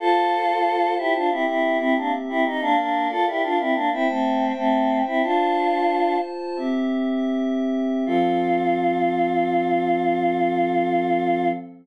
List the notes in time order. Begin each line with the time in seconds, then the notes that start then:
0.00 F4 A4 C5 A5
0.98 E4 G4
1.15 D4 F4
1.29 C4 E4 G4 E5
1.47 C4 E4
1.79 C4 E4
1.96 A#3 D4
2.29 C4 E4
2.45 D#4
2.60 A#3 D4 A#4 D5 F5
2.77 A#3 D4
3.10 F4 A4
3.27 E4 G4
3.43 D4 F4
3.59 C4 E4
3.74 A#3 D4
3.92 C4 E4 C5 E5 G5
4.07 A3 C4
4.57 A3 C4
5.06 C4 E4
5.22 D4 F4 C5 A5
6.56 C4 G4 E5
8.06 F3 C4 F4 A4